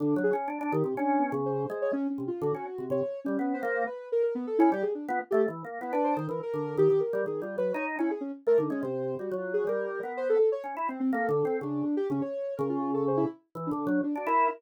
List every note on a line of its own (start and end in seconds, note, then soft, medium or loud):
0.00 0.15 D3 medium
0.00 0.22 D4 medium
0.16 0.31 F#3 loud
0.23 0.34 G#4 medium
0.33 0.48 C#4 medium
0.48 0.59 D4 medium
0.61 0.72 D4 loud
0.72 0.83 D#3 loud
0.72 0.94 G4 medium
0.84 0.95 C3 medium
0.97 1.30 C#4 loud
0.97 1.20 D4 medium
1.19 1.41 B3 medium
1.32 1.65 C#3 loud
1.46 1.78 C5 medium
1.70 1.91 G#3 loud
1.82 1.93 C#5 medium
1.93 2.07 C#4 loud
2.10 2.24 C#4 medium
2.18 2.29 C3 medium
2.28 2.42 F4 medium
2.42 2.52 D3 loud
2.42 2.85 F#4 medium
2.55 2.65 C#4 medium
2.78 2.89 C3 medium
2.90 3.01 C3 medium
2.90 3.20 C#5 medium
3.24 3.37 G3 medium
3.24 3.54 C#4 medium
3.39 3.61 B3 medium
3.54 3.83 C5 medium
3.63 3.85 A#3 loud
3.87 4.08 B4 medium
4.12 4.22 A#4 loud
4.23 4.34 A#4 medium
4.35 4.46 B3 loud
4.47 4.58 A4 medium
4.59 4.71 C#4 loud
4.59 4.69 E4 loud
4.72 4.83 G3 medium
4.72 4.84 G4 loud
4.82 4.93 G#4 medium
4.95 5.06 D4 medium
5.08 5.19 B3 loud
5.08 5.20 F4 medium
5.31 5.47 A3 loud
5.31 5.42 G4 loud
5.48 5.63 E3 medium
5.65 5.79 A#3 medium
5.81 5.92 B3 medium
5.81 5.92 E4 medium
5.93 6.15 D4 medium
5.93 6.04 B4 medium
6.04 6.26 C5 medium
6.17 6.28 D#3 medium
6.29 6.40 E3 medium
6.29 6.41 A#4 medium
6.43 6.75 A#4 loud
6.54 6.75 D3 medium
6.77 6.88 D#3 loud
6.77 7.00 G4 loud
6.90 7.01 D#3 medium
7.00 7.22 A#4 medium
7.13 7.24 G3 loud
7.26 7.41 D#3 medium
7.26 7.41 G#4 medium
7.42 7.56 G3 medium
7.42 7.56 F4 medium
7.58 7.72 F#3 medium
7.58 7.72 B4 medium
7.74 7.96 D#4 loud
7.74 7.85 C#5 medium
7.99 8.10 C#4 medium
7.99 8.10 E4 loud
8.11 8.22 G#4 medium
8.21 8.32 C#4 medium
8.47 8.57 A3 medium
8.47 8.58 A#4 loud
8.58 8.69 D3 medium
8.58 8.70 D#4 medium
8.70 8.81 G#3 medium
8.70 8.82 C#4 loud
8.83 9.15 C3 medium
8.83 9.15 C5 medium
9.19 9.30 G3 medium
9.19 9.34 F#4 medium
9.31 9.64 F#3 medium
9.37 9.52 F4 medium
9.54 9.68 G#4 medium
9.67 10.00 G3 medium
9.67 10.12 A#4 medium
10.03 10.36 B3 medium
10.17 10.28 C5 loud
10.29 10.38 A4 loud
10.39 10.49 A4 medium
10.52 10.63 C#5 medium
10.64 10.75 C#4 medium
10.77 10.88 E4 medium
10.89 10.99 C4 medium
10.89 11.00 C4 medium
11.00 11.11 C4 loud
11.13 11.27 A#3 loud
11.13 11.57 A4 medium
11.29 11.43 D3 loud
11.45 11.59 C4 medium
11.61 11.83 C#3 medium
11.61 11.95 D4 medium
11.97 12.08 G4 loud
12.10 12.21 C#3 medium
12.10 12.22 C#4 medium
12.21 12.54 C#5 medium
12.57 13.24 C#3 loud
12.57 12.68 A#4 medium
12.69 12.91 F4 medium
12.94 13.05 A4 medium
13.08 13.18 C5 soft
13.17 13.28 E4 loud
13.55 13.70 E3 medium
13.67 13.99 D4 medium
13.71 13.86 D3 loud
13.87 14.01 F#3 loud
14.04 14.14 D4 medium
14.16 14.26 D4 medium
14.16 14.28 F#4 medium
14.27 14.48 E4 loud
14.27 14.49 A#4 medium